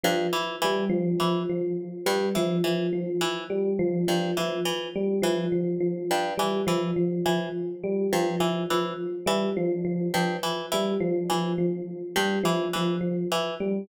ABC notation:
X:1
M:2/4
L:1/8
Q:1/4=104
K:none
V:1 name="Harpsichord" clef=bass
G,, E, E, z | E, z2 G,, | E, E, z E, | z2 G,, E, |
E, z E, z | z G,, E, E, | z E, z2 | G,, E, E, z |
E, z2 G,, | E, E, z E, | z2 G,, E, | E, z E, z |]
V:2 name="Electric Piano 1" clef=bass
F, z G, F, | F, F, z G, | F, F, F, z | G, F, F, F, |
z G, F, F, | F, z G, F, | F, F, z G, | F, F, F, z |
G, F, F, F, | z G, F, F, | F, z G, F, | F, F, z G, |]